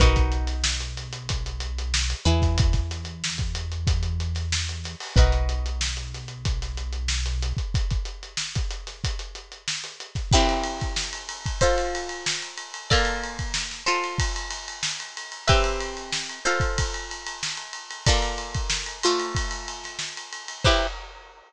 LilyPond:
<<
  \new Staff \with { instrumentName = "Pizzicato Strings" } { \time 4/4 \key b \mixolydian \tempo 4 = 93 <dis' fis' ais' b'>2.~ <dis' fis' ais' b'>8 <e' gis' b'>8~ | <e' gis' b'>1 | <dis' fis' ais' b'>1 | r1 |
\key c \mixolydian <c' e' g' b'>2 <f' a' c''>2 | <bes f' a' d''>4. <f' a' c''>2~ <f' a' c''>8 | <c' g' b' e''>4. <f' a' c''>2~ <f' a' c''>8 | <bes f' a' d''>4. <a f' c''>2~ <a f' c''>8 |
<e' g' b' c''>4 r2. | }
  \new Staff \with { instrumentName = "Synth Bass 1" } { \clef bass \time 4/4 \key b \mixolydian b,,2.~ b,,8 e,8~ | e,1 | b,,1 | r1 |
\key c \mixolydian r1 | r1 | r1 | r1 |
r1 | }
  \new DrumStaff \with { instrumentName = "Drums" } \drummode { \time 4/4 <hh bd>16 <hh bd>16 hh16 <hh sn>16 sn16 hh16 <hh sn>16 hh16 <hh bd>16 hh16 hh16 hh16 sn16 hh16 hh16 <hh bd sn>16 | <hh bd>16 <hh bd sn>16 <hh sn>16 hh16 sn16 <hh bd>16 hh16 hh16 <hh bd>16 hh16 hh16 <hh sn>16 sn16 hh16 <hh sn>16 hho16 | <hh bd>16 hh16 hh16 hh16 sn16 hh16 <hh sn>16 hh16 <hh bd>16 <hh sn>16 hh16 hh16 sn16 <hh sn>16 hh16 <hh bd>16 | <hh bd>16 <hh bd>16 hh16 hh16 sn16 <hh bd>16 hh16 <hh sn>16 <hh bd>16 hh16 hh16 hh16 sn16 <hh sn>16 hh16 <hh bd sn>16 |
<cymc bd>16 cymr16 cymr16 <bd cymr sn>16 sn16 cymr16 cymr16 <bd cymr sn>16 <bd cymr>16 <cymr sn>16 cymr16 cymr16 sn16 <cymr sn>16 cymr16 cymr16 | <bd cymr>16 cymr16 cymr16 <bd cymr>16 sn16 sn16 cymr16 cymr16 <bd cymr>16 cymr16 <cymr sn>16 cymr16 sn16 cymr16 cymr16 cymr16 | <bd cymr>16 cymr16 cymr16 cymr16 sn16 cymr16 cymr16 <bd cymr>16 <bd cymr>16 cymr16 cymr16 cymr16 sn16 cymr16 cymr16 cymr16 | <bd cymr>16 cymr16 <cymr sn>16 <bd cymr>16 sn16 cymr16 cymr16 cymr16 <bd cymr>16 <cymr sn>16 cymr16 <cymr sn>16 sn16 <cymr sn>16 cymr16 cymr16 |
<cymc bd>4 r4 r4 r4 | }
>>